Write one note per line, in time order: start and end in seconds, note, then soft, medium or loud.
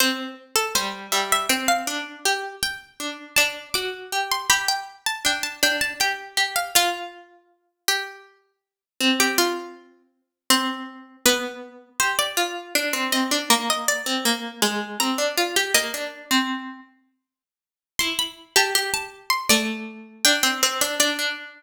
0.00 0.34 C4 medium
0.00 0.33 C5 loud
0.56 0.73 A4 medium
0.75 1.07 G3 medium
0.75 0.93 C5 medium
1.12 1.46 G3 medium
1.12 1.30 E5 medium
1.32 1.50 E5 loud
1.49 1.86 C4 medium
1.49 1.67 G5 medium
1.68 2.17 F5 loud
1.87 2.19 D4 medium
2.25 2.56 G4 medium
2.63 2.93 G5 loud
3.00 3.35 D4 medium
3.36 3.69 D4 medium
3.36 3.67 A5 medium
3.74 4.10 F#4 medium
3.74 4.19 D6 medium
4.12 4.46 G4 medium
4.32 4.49 C6 medium
4.50 4.83 G4 medium
4.50 4.67 B5 medium
4.68 5.01 G5 medium
5.06 5.24 A5 medium
5.25 5.56 D4 medium
5.25 5.44 G5 medium
5.43 5.61 A5 medium
5.63 5.93 D4 medium
5.63 5.81 G5 loud
5.81 5.99 A5 medium
6.00 6.32 G4 medium
6.00 6.53 G5 loud
6.37 6.71 G4 medium
6.56 6.74 F5 medium
6.75 8.58 F4 medium
6.75 7.11 F4 loud
7.88 8.53 G4 loud
9.00 10.21 C4 medium
9.20 9.38 G4 loud
9.38 10.02 F4 loud
10.50 11.17 C4 medium
10.50 11.17 C5 medium
11.25 11.89 B3 medium
11.25 11.91 B4 loud
12.00 12.31 G4 medium
12.00 12.18 C5 loud
12.19 12.37 D5 loud
12.37 12.74 F4 medium
12.75 12.93 D4 medium
12.93 13.11 C4 medium
13.12 13.30 C4 medium
13.12 13.47 D#5 loud
13.31 13.49 D4 medium
13.50 14.03 A#3 medium
13.70 13.88 D#5 medium
13.88 14.61 D5 loud
14.06 14.24 C4 medium
14.25 14.61 A#3 medium
14.62 14.98 G#3 medium
15.00 15.18 C4 medium
15.00 15.62 A#5 loud
15.18 15.36 D4 medium
15.38 15.55 F4 medium
15.56 15.74 G4 medium
15.74 15.93 A#3 medium
15.74 16.82 D#5 loud
15.94 16.25 D4 medium
16.31 16.80 C4 medium
17.99 18.50 E4 medium
17.99 18.17 C6 loud
18.19 18.37 B5 loud
18.56 18.74 G4 medium
18.56 18.75 A5 medium
18.75 19.48 G4 medium
18.94 19.26 A5 medium
19.30 19.48 C6 loud
19.49 20.23 A3 medium
19.49 20.14 D5 loud
20.25 20.43 D4 loud
20.25 20.43 G5 loud
20.43 20.61 C4 medium
20.43 20.79 G5 medium
20.63 20.81 C4 medium
20.81 20.99 D4 medium
21.00 21.18 D4 medium
21.00 21.61 D5 loud
21.19 21.63 D4 medium